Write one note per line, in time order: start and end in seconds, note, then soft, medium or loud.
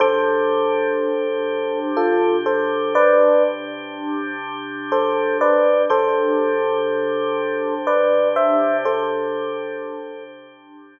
0.00 5.85 C3 medium
0.00 5.85 D4 medium
0.00 5.85 G4 medium
0.00 1.80 A4 medium
0.00 1.80 C5 loud
1.97 2.36 F4 medium
1.97 2.36 A4 medium
2.46 2.93 A4 medium
2.46 2.93 C5 medium
2.95 3.43 B4 loud
2.95 3.43 D5 loud
4.92 5.38 A4 medium
4.92 5.38 C5 medium
5.41 5.82 B4 medium
5.41 5.82 D5 medium
5.89 10.99 C3 medium
5.89 10.99 D4 medium
5.89 10.99 G4 medium
5.89 7.74 A4 medium
5.89 7.74 C5 loud
7.87 8.28 B4 medium
7.87 8.28 D5 medium
8.36 8.77 C5 medium
8.36 8.77 E5 medium
8.85 10.24 A4 medium
8.85 10.24 C5 medium